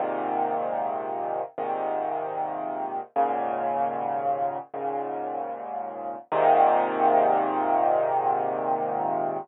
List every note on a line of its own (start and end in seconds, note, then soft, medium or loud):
0.00 1.42 G#2 medium
0.00 1.42 A#2 medium
0.00 1.42 C3 medium
0.00 1.42 D#3 medium
1.58 3.00 G#2 medium
1.58 3.00 A#2 medium
1.58 3.00 C3 medium
1.58 3.00 D#3 medium
3.16 4.58 D#2 medium
3.16 4.58 G#2 medium
3.16 4.58 A#2 medium
3.16 4.58 C#3 medium
4.74 6.16 D#2 medium
4.74 6.16 G#2 medium
4.74 6.16 A#2 medium
4.74 6.16 C#3 medium
6.32 9.38 G#2 medium
6.32 9.38 A#2 loud
6.32 9.38 C3 loud
6.32 9.38 D#3 loud